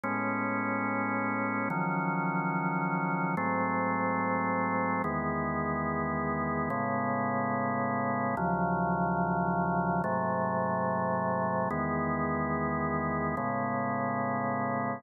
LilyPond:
\new Staff { \time 4/4 \key cis \minor \tempo 4 = 144 <a, gis b cis'>1 | <dis eis fis cis'>1 | <gis, fis a bis>1 | <e, dis gis b>1 |
<a, cis gis b>1 | <dis, cis eis fis>1 | <gis, bis, fis a>1 | <e, dis gis b>1 |
<a, cis gis b>1 | }